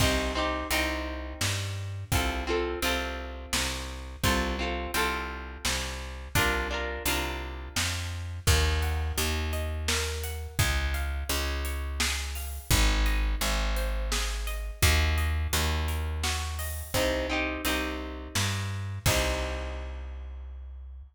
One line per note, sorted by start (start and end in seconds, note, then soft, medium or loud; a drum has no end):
0.00 0.64 C2 medium
0.00 0.32 C4 loud
0.00 0.32 D#4 medium
0.00 0.32 G4 medium
0.00 kick loud
0.00 crash medium
0.35 0.68 C4 medium
0.35 0.68 D#4 medium
0.35 0.68 G4 medium
0.71 1.34 C2 medium
0.71 2.00 C4 medium
0.71 2.00 D#4 medium
0.71 2.00 G4 medium
0.71 closed hi-hat loud
1.41 2.04 G2 medium
1.41 snare loud
2.12 2.75 C2 medium
2.12 2.44 C4 medium
2.12 2.44 F4 medium
2.12 2.44 A4 medium
2.12 kick loud
2.12 closed hi-hat medium
2.47 2.80 C4 medium
2.47 2.80 F4 medium
2.47 2.80 A4 medium
2.82 3.46 C2 medium
2.82 4.12 C4 medium
2.82 4.12 F4 medium
2.82 4.12 A4 medium
2.82 closed hi-hat medium
3.53 4.16 C2 medium
3.53 snare loud
4.24 4.87 C2 medium
4.24 4.56 C4 medium
4.24 4.56 F4 loud
4.24 4.56 A4 medium
4.24 kick loud
4.24 closed hi-hat medium
4.59 4.91 C4 medium
4.59 4.91 F4 medium
4.59 4.91 A4 medium
4.94 5.58 C2 medium
4.94 6.24 C4 medium
4.94 6.24 F4 medium
4.94 6.24 A4 medium
4.94 closed hi-hat loud
5.65 6.29 C2 medium
5.65 snare loud
6.35 6.99 C2 medium
6.35 6.68 D4 loud
6.35 6.68 F4 loud
6.35 6.68 A#4 loud
6.35 kick loud
6.35 closed hi-hat loud
6.71 7.03 D4 medium
6.71 7.03 F4 medium
6.71 7.03 A#4 medium
7.06 7.69 C2 medium
7.06 8.36 D4 medium
7.06 8.36 F4 medium
7.06 8.36 A#4 medium
7.06 closed hi-hat loud
7.76 8.40 F2 medium
7.76 snare loud
8.47 9.12 D#2 loud
8.47 9.17 A#4 medium
8.47 kick loud
8.47 crash medium
8.82 10.23 F#5 medium
8.82 closed hi-hat medium
9.17 10.47 D#2 medium
9.17 9.88 A#4 medium
9.17 closed hi-hat loud
9.53 10.54 D#5 medium
9.53 closed hi-hat medium
9.88 10.55 A#4 medium
9.88 snare loud
10.24 10.57 F#5 medium
10.24 closed hi-hat medium
10.59 11.24 C#2 medium
10.59 11.29 G#4 medium
10.59 kick loud
10.59 closed hi-hat loud
10.94 12.35 F5 medium
10.94 closed hi-hat medium
11.29 12.59 C#2 medium
11.29 12.00 G#4 medium
11.29 closed hi-hat loud
11.65 12.65 C#5 medium
11.65 closed hi-hat medium
12.00 12.67 G#4 medium
12.00 snare loud
12.35 12.69 F5 medium
12.35 open hi-hat medium
12.71 13.35 G#1 loud
12.71 13.41 G#4 medium
12.71 kick loud
12.71 closed hi-hat medium
13.06 14.46 D#5 medium
13.06 closed hi-hat medium
13.41 14.71 G#1 medium
13.41 14.11 G#4 medium
13.41 closed hi-hat medium
13.76 14.77 C5 medium
13.76 closed hi-hat medium
14.12 14.79 G#4 medium
14.12 snare loud
14.47 14.81 D#5 medium
14.47 closed hi-hat medium
14.82 15.47 D#2 loud
14.82 15.52 F#4 medium
14.82 kick loud
14.82 closed hi-hat loud
15.18 16.58 D#5 medium
15.18 closed hi-hat medium
15.53 16.83 D#2 medium
15.53 16.23 F#4 medium
15.53 closed hi-hat loud
15.88 16.89 A#4 medium
15.88 closed hi-hat medium
16.24 16.91 F#4 medium
16.24 snare loud
16.59 16.92 D#5 medium
16.59 open hi-hat medium
16.94 17.58 C2 medium
16.94 17.27 C4 loud
16.94 17.27 D#4 medium
16.94 17.27 G4 medium
16.94 kick medium
16.94 closed hi-hat medium
17.30 17.62 C4 medium
17.30 17.62 D#4 medium
17.30 17.62 G4 medium
17.65 18.28 C2 medium
17.65 18.95 C4 medium
17.65 18.95 D#4 medium
17.65 18.95 G4 medium
17.65 closed hi-hat loud
18.35 18.99 G2 medium
18.35 snare loud
19.06 21.03 C2 medium
19.06 21.03 C4 medium
19.06 21.03 D#4 medium
19.06 21.03 G4 medium
19.06 kick loud
19.06 crash loud